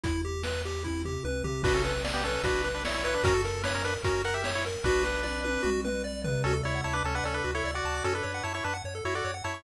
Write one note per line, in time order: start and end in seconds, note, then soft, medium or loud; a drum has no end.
0.04 1.18 E2 medium
0.04 0.22 E4 medium
0.04 kick loud
0.04 closed hi-hat loud
0.25 0.43 G4 medium
0.43 0.62 B4 medium
0.43 snare loud
0.65 0.83 G4 medium
0.83 1.02 E4 medium
0.83 kick medium
0.83 high tom medium
1.05 1.23 G4 medium
1.05 floor tom medium
1.24 1.43 C#2 medium
1.24 1.43 B4 medium
1.24 high tom medium
1.44 1.62 C2 medium
1.44 1.62 G4 medium
1.44 floor tom loud
1.63 2.38 B1 loud
1.63 1.73 D4 medium
1.63 1.82 F#4 loud
1.63 1.73 B4 medium
1.63 kick loud
1.63 crash loud
1.74 1.93 C#4 medium
1.74 1.93 A4 medium
1.84 2.02 B4 medium
1.84 closed hi-hat medium
2.04 2.22 D5 medium
2.04 snare loud
2.14 2.23 B3 medium
2.14 2.23 G4 medium
2.24 2.42 C#4 medium
2.24 2.42 A4 medium
2.24 2.43 B4 medium
2.24 closed hi-hat medium
2.43 3.17 B1 medium
2.43 2.69 D4 medium
2.43 2.62 F#4 medium
2.43 2.69 B4 medium
2.43 kick loud
2.43 closed hi-hat loud
2.64 2.82 B4 medium
2.64 closed hi-hat medium
2.75 2.84 D4 medium
2.75 2.84 B4 medium
2.85 2.94 E4 medium
2.85 2.94 C#5 medium
2.85 3.03 D5 medium
2.85 snare loud
2.94 3.04 E4 medium
2.94 3.04 C#5 medium
3.04 3.14 E4 medium
3.04 3.22 B4 medium
3.04 3.14 C#5 medium
3.04 closed hi-hat medium
3.14 3.24 D4 medium
3.14 3.24 B4 medium
3.24 3.97 F#2 loud
3.24 3.34 C#4 medium
3.24 3.42 F#4 loud
3.24 3.34 A#4 loud
3.24 kick loud
3.24 closed hi-hat loud
3.34 3.62 A4 medium
3.44 3.62 A#4 medium
3.44 closed hi-hat medium
3.63 3.73 D4 medium
3.63 3.73 B4 medium
3.63 3.83 C#5 loud
3.63 snare loud
3.74 3.84 C#4 medium
3.74 3.84 A#4 medium
3.84 3.94 D4 medium
3.84 4.02 A#4 medium
3.84 3.94 B4 medium
3.84 closed hi-hat medium
4.03 4.77 F#2 medium
4.03 4.22 C#4 medium
4.03 4.22 F#4 medium
4.03 4.22 A#4 medium
4.03 kick loud
4.03 closed hi-hat loud
4.24 4.43 A#4 medium
4.24 4.34 A#4 medium
4.24 4.34 F#5 medium
4.24 closed hi-hat medium
4.34 4.50 G4 medium
4.34 4.50 E5 medium
4.44 4.63 C#5 medium
4.44 snare loud
4.55 4.65 E4 medium
4.55 4.65 C#5 medium
4.65 4.84 A#4 medium
4.65 closed hi-hat medium
4.84 5.58 B1 loud
4.84 5.70 D4 medium
4.84 5.03 F#4 loud
4.84 5.70 B4 medium
4.84 kick loud
4.84 snare medium
5.03 5.21 B4 medium
5.03 snare medium
5.23 5.41 D5 medium
5.23 high tom medium
5.44 5.62 B4 medium
5.44 high tom medium
5.63 6.38 B1 medium
5.63 5.81 F#4 loud
5.63 mid tom loud
5.85 6.03 B4 medium
5.85 mid tom loud
6.04 6.22 D5 medium
6.24 6.42 B4 medium
6.24 floor tom loud
6.44 6.62 D2 medium
6.44 6.53 C#4 medium
6.44 6.55 F#4 medium
6.44 6.53 A4 loud
6.53 6.62 A4 medium
6.63 6.82 D2 medium
6.63 6.81 E4 medium
6.63 6.81 C#5 medium
6.63 6.72 D5 medium
6.75 6.84 F#5 medium
6.84 7.02 D2 medium
6.84 6.94 E4 medium
6.84 6.94 C#5 medium
6.84 6.93 A5 medium
6.93 7.03 D4 medium
6.93 7.03 B4 medium
6.93 7.02 D6 medium
7.04 7.21 D2 medium
7.04 7.15 C#4 medium
7.04 7.15 A4 medium
7.04 7.13 A5 medium
7.15 7.24 D4 medium
7.15 7.24 B4 medium
7.15 7.24 F#5 medium
7.24 7.41 D2 medium
7.24 7.35 C#4 medium
7.24 7.35 A4 medium
7.24 7.33 D5 medium
7.34 7.51 D4 medium
7.34 7.43 A4 medium
7.34 7.51 B4 medium
7.44 7.62 D2 medium
7.44 7.53 F#4 medium
7.55 7.71 E4 medium
7.55 7.64 A4 medium
7.55 7.71 C#5 medium
7.64 7.81 D2 medium
7.64 7.74 D5 medium
7.74 8.04 F#4 medium
7.74 8.04 D5 medium
7.74 7.83 F#5 medium
7.85 8.02 D2 medium
7.85 7.94 A5 medium
7.94 8.03 D6 medium
8.04 8.22 F#2 medium
8.04 8.14 C#4 medium
8.04 8.13 F#4 medium
8.04 8.14 A4 loud
8.14 8.43 D4 medium
8.14 8.23 A4 medium
8.14 8.43 B4 medium
8.23 8.41 F#2 medium
8.23 8.32 C#5 medium
8.34 8.43 F#5 medium
8.43 8.61 F#2 medium
8.43 8.53 E4 medium
8.43 8.53 C#5 medium
8.43 8.53 A5 medium
8.54 8.64 E4 medium
8.54 8.64 C#5 medium
8.54 8.63 C#6 medium
8.64 8.82 F#2 medium
8.64 8.74 D4 medium
8.64 8.74 B4 medium
8.64 8.74 A5 medium
8.74 8.83 F#5 medium
8.84 9.01 F#2 medium
8.84 8.94 C#5 medium
8.95 9.04 A4 medium
9.05 9.22 F#2 medium
9.05 9.15 E4 medium
9.05 9.14 F#4 medium
9.05 9.15 C#5 medium
9.15 9.31 F#4 medium
9.15 9.24 A4 medium
9.15 9.31 D5 medium
9.25 9.42 F#2 medium
9.25 9.34 C#5 medium
9.34 9.43 F#5 medium
9.44 9.62 F#2 medium
9.44 9.62 E4 medium
9.44 9.62 C#5 medium
9.44 9.53 A5 medium
9.54 9.63 C#6 medium